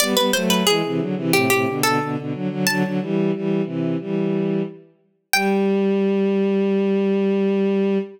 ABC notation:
X:1
M:4/4
L:1/16
Q:1/4=90
K:G
V:1 name="Harpsichord"
d B c B ^G4 =G G2 A2 z3 | a10 z6 | g16 |]
V:2 name="Violin"
[G,B,] [G,B,] [F,A,]2 [E,^G,] [C,E,] [D,F,] [C,E,] [A,,C,] [A,,C,] [B,,D,] [B,,D,] [B,,D,] [B,,D,] [D,F,] [D,F,] | [D,F,] [D,F,] [E,G,]2 [E,G,]2 [C,E,]2 [E,G,]4 z4 | G,16 |]